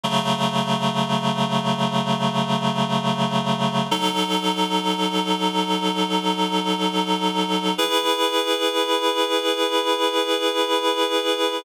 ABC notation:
X:1
M:4/4
L:1/8
Q:1/4=62
K:E
V:1 name="Clarinet"
[C,F,A,]8 | [F,DA]8 | [EGB]8 |]